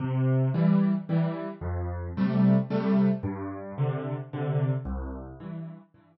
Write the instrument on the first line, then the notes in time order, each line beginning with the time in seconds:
acoustic grand piano
0.00 C3
0.54 E3 G3
1.09 E3 G3
1.61 F2
2.17 C3 G3 A3
2.70 C3 G3 A3
3.23 G2
3.78 C3 D3
4.33 C3 D3
4.85 C2
5.40 G2 E3
5.94 G2 E3